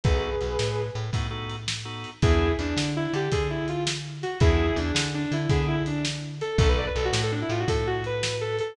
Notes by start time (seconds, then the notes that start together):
0.04 B1 B3 D#4 F#4 G#4 A4 B4, kick, closed hi-hat
0.41 B1, closed hi-hat
0.59 A2, snare
0.95 A2, closed hi-hat
1.13 A2 B3 D#4 F#4 A4, kick, closed hi-hat
1.31 B3 D#4 F#4 A4
1.50 closed hi-hat
1.68 snare
1.85 B3 D#4 F#4 A4
2.04 closed hi-hat
2.22 E2 B3 D4 E4 G#4, kick, closed hi-hat
2.59 E2 D4, closed hi-hat
2.76 D3, snare
2.96 E4
3.13 D3 G4, closed hi-hat
3.32 D3 G#4, kick, closed hi-hat
3.50 E4
3.68 F4, closed hi-hat
3.87 snare
4.23 F#4, closed hi-hat
4.40 E2 B3 D4 E4 G#4, kick, closed hi-hat
4.76 E2 D4, closed hi-hat
4.95 D3, snare
5.14 D4
5.32 D3 E4, closed hi-hat
5.49 D3 B3 D4 E4 G#4, kick, closed hi-hat
5.67 E4
5.86 D4, closed hi-hat
6.05 snare
6.41 A4, closed hi-hat
6.58 B1 B3 D#4 F#4 A4, kick, closed hi-hat
6.69 B4
6.78 D5
6.87 B4
6.96 B1 A4, closed hi-hat
7.05 F#4
7.13 A2, snare
7.23 A4
7.32 D4
7.42 E4
7.49 A2 F4, closed hi-hat
7.60 F#4
7.68 A2 A4, kick, closed hi-hat
7.87 F#4
8.04 B4, closed hi-hat
8.23 snare
8.41 A4
8.59 A4, closed hi-hat